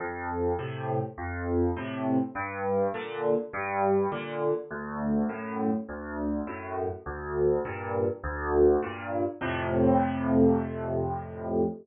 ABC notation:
X:1
M:4/4
L:1/8
Q:1/4=102
K:F
V:1 name="Acoustic Grand Piano" clef=bass
F,,2 [A,,C,]2 F,,2 [A,,C,]2 | G,,2 [B,,D,]2 G,,2 [B,,D,]2 | D,,2 [^F,,A,,]2 D,,2 [F,,A,,]2 | D,,2 [G,,B,,]2 D,,2 [G,,B,,]2 |
[F,,A,,C,]8 |]